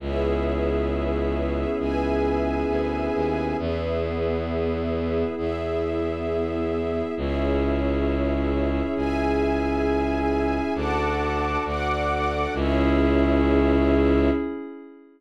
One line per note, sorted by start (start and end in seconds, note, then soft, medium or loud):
0.00 1.65 C#2 medium
0.00 3.55 B3 medium
0.00 3.55 C#4 medium
0.00 3.55 E4 medium
0.00 3.55 G#4 medium
0.00 1.78 G#4 medium
0.00 1.78 B4 medium
0.00 1.78 C#5 medium
0.00 1.78 E5 medium
1.79 2.64 C#2 medium
1.79 3.56 G#4 medium
1.79 3.56 B4 medium
1.79 3.56 E5 medium
1.79 3.56 G#5 medium
2.69 3.09 D2 medium
3.14 3.54 D#2 medium
3.58 5.24 E2 medium
3.58 7.13 B3 medium
3.58 7.13 E4 medium
3.58 5.35 G#4 medium
3.58 7.13 G#4 medium
3.58 5.35 B4 medium
3.58 5.35 E5 medium
5.37 7.02 E2 medium
5.37 7.14 E4 medium
5.37 7.14 G#4 medium
5.37 7.14 E5 medium
7.16 8.81 C#2 medium
7.16 10.71 C#4 medium
7.16 10.71 E4 medium
7.16 10.71 G#4 medium
7.16 8.94 G#4 medium
7.16 8.94 C#5 medium
7.16 8.94 E5 medium
8.95 10.60 C#2 medium
8.95 10.73 G#4 medium
8.95 10.73 E5 medium
8.95 10.73 G#5 loud
10.75 11.57 D2 medium
10.75 12.52 D4 medium
10.75 12.52 F#4 medium
10.75 12.52 A4 medium
10.75 11.63 F#5 medium
10.75 11.63 A5 medium
10.75 11.63 D6 medium
11.64 12.47 D2 medium
11.64 12.54 D5 medium
11.64 12.54 F#5 loud
11.64 12.54 D6 medium
12.53 14.29 C#2 loud
12.53 14.29 C#4 loud
12.53 14.29 E4 loud
12.53 14.29 G#4 loud
12.53 14.29 G#4 medium
12.53 14.29 C#5 loud
12.53 14.29 E5 loud